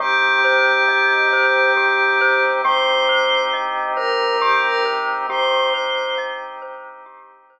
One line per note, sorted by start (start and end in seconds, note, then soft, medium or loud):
0.00 0.81 C2 medium
0.00 2.62 C4 medium
0.00 2.62 D#4 medium
0.00 0.39 G4 loud
0.00 2.41 G4 loud
0.00 2.62 G4 medium
0.44 0.84 C5 medium
0.88 2.51 C2 medium
0.88 1.28 D#5 medium
1.33 1.72 C5 medium
1.77 2.16 G4 medium
2.21 2.61 C5 loud
2.64 3.46 C2 medium
2.64 5.27 C4 medium
2.64 5.27 D#4 medium
2.64 3.04 G4 loud
2.64 5.27 G4 medium
2.64 3.40 C5 loud
3.09 3.49 C5 medium
3.53 5.16 C2 medium
3.53 3.93 D#5 medium
3.96 4.35 A#4 loud
3.96 4.37 C5 medium
4.40 4.61 G4 loud
4.40 4.81 G4 loud
4.64 4.85 A#4 medium
4.85 5.25 C5 medium
5.29 6.10 C2 medium
5.29 7.59 C4 medium
5.29 7.59 D#4 medium
5.29 7.59 G4 medium
5.29 5.69 G4 loud
5.29 6.16 C5 loud
5.74 6.13 C5 medium
6.18 7.59 C2 medium
6.18 6.58 D#5 medium
6.62 7.01 C5 medium
7.06 7.46 G4 medium
7.50 7.59 C5 medium